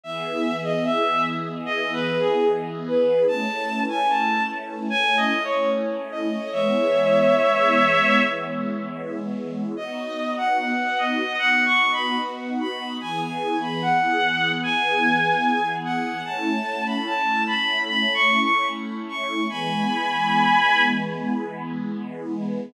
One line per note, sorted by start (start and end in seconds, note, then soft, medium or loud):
0.04 3.25 E3 medium
0.04 3.25 B3 medium
0.04 3.25 G#4 medium
0.04 0.56 E5 loud
0.64 0.84 D#5 medium
0.85 1.22 E5 medium
1.66 1.91 D#5 medium
1.93 2.18 B4 medium
2.20 2.45 G#4 medium
2.87 3.23 B4 medium
3.28 6.48 A3 medium
3.28 6.48 C#4 medium
3.28 6.48 E4 medium
3.28 3.80 A5 loud
3.89 4.08 G#5 medium
4.09 4.43 A5 medium
4.90 5.16 G#5 loud
5.17 5.43 D#5 loud
5.44 5.70 C#5 medium
6.12 6.51 D#5 medium
6.52 9.73 E3 medium
6.52 9.73 G#3 medium
6.52 9.73 B3 medium
6.52 8.20 C#5 medium
6.52 8.20 E5 medium
9.77 12.98 B3 medium
9.77 12.98 D#4 medium
9.77 12.98 F#4 medium
9.77 10.32 D#5 medium
10.37 10.57 F#5 medium
10.58 10.94 F#5 medium
10.98 11.36 D#5 medium
11.39 11.64 F#5 loud
11.66 11.91 C#6 medium
11.93 12.18 B5 medium
12.60 12.93 B5 medium
13.01 16.22 E3 medium
13.01 16.22 B3 medium
13.01 16.22 G#4 medium
13.01 13.20 G#5 medium
13.21 13.56 G#5 medium
13.62 13.81 B5 medium
13.82 14.50 F#5 medium
14.63 15.69 G#5 medium
15.85 16.23 F#5 medium
16.25 19.46 A3 medium
16.25 19.46 C#4 medium
16.25 19.46 E4 medium
16.25 16.83 A5 loud
16.86 17.05 B5 medium
17.06 17.43 A5 medium
17.47 17.80 B5 medium
17.87 18.13 B5 medium
18.14 18.40 C#6 medium
18.41 18.67 C#6 medium
19.09 19.45 C#6 medium
19.48 22.70 E3 medium
19.48 22.70 G#3 medium
19.48 22.70 B3 medium
19.48 20.81 G#5 medium
19.48 20.81 B5 medium